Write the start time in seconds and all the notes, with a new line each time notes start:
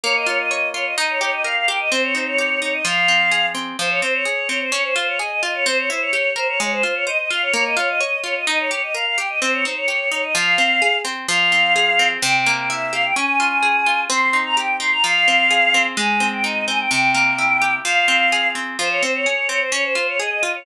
0.03 A#3 C#5
0.15 D#5
0.26 F4 C#5
0.39 D#5
0.51 C#5
0.74 F4 C#5
0.86 D#5
0.97 D#4 D#5
1.09 C#5
1.21 G4 C#5
1.33 D#5
1.44 A#4 F5
1.56 F5
1.68 G4 G5
1.79 D#5
1.91 C4 C5
2.03 C#5
2.15 D#4 C5
2.26 C#5
2.38 G4
2.61 D#4 C#5
2.73 D#5
2.85 F3 F5
3.08 C4
3.31 G#4
3.55 C4
3.79 F3 C5
3.90 C#5
4.02 C4 C5
4.14 C#5
4.25 G#4
4.49 C4 C#5
4.61 C5
4.72 C#4 C#5
4.84 C5
4.96 F4 C5
5.07 C#5
5.19 G#4 D#5
5.31 D#5
5.43 F4 D#5
5.54 C#5
5.66 C4 C5
5.78 C#5
5.90 E4 C5
6.01 C#5
6.13 G4
6.36 A#4 C5
6.48 C#5
6.60 G#3 C#5
6.72 C5
6.83 F4 C5
6.95 C#5
7.07 C5 D#5
7.19 D#5
7.30 F4 F5
7.42 C#5
7.53 A#3 C#5
7.65 D#5
7.77 F4 C#5
7.89 D#5
8.00 C#5
8.24 F4 C#5
8.36 D#5
8.47 D#4 D#5
8.59 C#5
8.71 G4 C#5
8.83 D#5
8.94 A#4 F5
9.06 F5
9.18 G4 G5
9.29 D#5
9.41 C4 C5
9.53 C#5
9.65 D#4 C5
9.76 C#5
9.88 G4
10.11 D#4 C#5
10.23 D#5
10.35 F3 F5
10.58 C4
10.82 G#4
11.05 C4
11.28 F3 F5
11.52 C4
11.76 G#4
11.99 C4
12.22 C3 G5
12.46 A#3
12.58 G5
12.69 E4 E5
12.93 G4 F5
13.04 G5
13.16 C#4 G#5
13.40 F4
13.62 G#4
13.86 F4
14.10 C4 C6
14.33 D#4
14.45 A#5
14.57 G4 G5
14.80 D#4 C6
14.92 A#5
15.04 F3 F5
15.28 C4
15.50 G#4
15.74 C4
15.97 G#3 G#5
16.20 C4
16.33 G5
16.44 D#4 D#5
16.68 C4 G#5
16.79 G5
16.91 C3 G5
17.14 A#3
17.38 E4
17.62 G4
17.85 F3 F5
18.08 C4
18.32 G#4
18.55 C4
18.79 F3 C5
18.90 C#5
19.02 C4 C5
19.14 C#5
19.26 G#4
19.49 C4 C#5
19.61 C5
19.72 C#4 C#5
19.84 C5
19.95 F4 C5
20.08 C#5
20.19 G#4 D#5
20.31 D#5
20.43 F4 D#5
20.55 C#5